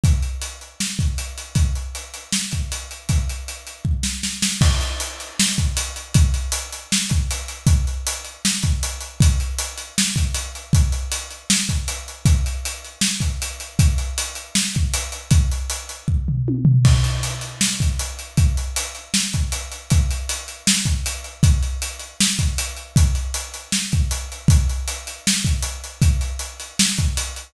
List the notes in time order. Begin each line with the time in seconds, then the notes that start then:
0.04 kick, closed hi-hat
0.23 closed hi-hat
0.42 closed hi-hat
0.61 closed hi-hat
0.80 snare
0.99 kick, closed hi-hat
1.18 closed hi-hat
1.38 closed hi-hat
1.55 kick, closed hi-hat
1.75 closed hi-hat
1.95 closed hi-hat
2.14 closed hi-hat
2.32 snare
2.52 kick, closed hi-hat
2.72 closed hi-hat
2.91 closed hi-hat
3.09 kick, closed hi-hat
3.29 closed hi-hat
3.48 closed hi-hat
3.67 closed hi-hat
3.85 kick
4.03 snare
4.23 snare
4.42 snare
4.61 kick, crash
4.81 closed hi-hat
5.00 closed hi-hat
5.20 closed hi-hat
5.39 snare
5.58 kick, closed hi-hat
5.77 closed hi-hat
5.96 closed hi-hat
6.14 kick, closed hi-hat
6.34 closed hi-hat
6.52 closed hi-hat
6.73 closed hi-hat
6.92 snare
7.09 kick, closed hi-hat
7.31 closed hi-hat
7.48 closed hi-hat
7.67 kick, closed hi-hat
7.87 closed hi-hat
8.07 closed hi-hat
8.25 closed hi-hat
8.45 snare
8.63 kick, closed hi-hat
8.83 closed hi-hat
9.01 closed hi-hat
9.20 kick, closed hi-hat
9.40 closed hi-hat
9.59 closed hi-hat
9.78 closed hi-hat
9.98 snare
10.16 kick, closed hi-hat
10.34 closed hi-hat
10.55 closed hi-hat
10.73 kick, closed hi-hat
10.92 closed hi-hat
11.12 closed hi-hat
11.31 closed hi-hat
11.50 snare
11.69 kick, closed hi-hat
11.88 closed hi-hat
12.08 closed hi-hat
12.25 kick, closed hi-hat
12.46 closed hi-hat
12.65 closed hi-hat
12.84 closed hi-hat
13.01 snare
13.20 kick, closed hi-hat
13.42 closed hi-hat
13.60 closed hi-hat
13.79 kick, closed hi-hat
13.98 closed hi-hat
14.18 closed hi-hat
14.35 closed hi-hat
14.55 snare
14.75 kick, closed hi-hat
14.94 closed hi-hat
15.12 closed hi-hat
15.31 kick, closed hi-hat
15.52 closed hi-hat
15.70 closed hi-hat
15.89 closed hi-hat
16.08 kick
16.28 floor tom
16.48 high tom
16.65 floor tom
16.85 kick, crash
17.04 closed hi-hat
17.23 closed hi-hat
17.41 closed hi-hat
17.61 snare
17.80 kick, closed hi-hat
17.99 closed hi-hat
18.19 closed hi-hat
18.37 kick, closed hi-hat
18.57 closed hi-hat
18.76 closed hi-hat
18.95 closed hi-hat
19.14 snare
19.33 kick, closed hi-hat
19.52 closed hi-hat
19.72 closed hi-hat
19.90 kick, closed hi-hat
20.11 closed hi-hat
20.29 closed hi-hat
20.48 closed hi-hat
20.67 snare
20.86 kick, closed hi-hat
21.06 closed hi-hat
21.24 closed hi-hat
21.43 kick, closed hi-hat
21.63 closed hi-hat
21.82 closed hi-hat
21.99 closed hi-hat
22.20 snare
22.39 kick, closed hi-hat
22.58 closed hi-hat
22.77 closed hi-hat
22.96 kick, closed hi-hat
23.15 closed hi-hat
23.34 closed hi-hat
23.54 closed hi-hat
23.72 snare
23.92 kick, closed hi-hat
24.11 closed hi-hat
24.32 closed hi-hat
24.48 kick, closed hi-hat
24.70 closed hi-hat
24.88 closed hi-hat
25.07 closed hi-hat
25.27 snare
25.45 kick, closed hi-hat
25.63 closed hi-hat
25.84 closed hi-hat
26.02 kick, closed hi-hat
26.21 closed hi-hat
26.39 closed hi-hat
26.60 closed hi-hat
26.79 snare
26.98 kick, closed hi-hat
27.17 closed hi-hat
27.36 closed hi-hat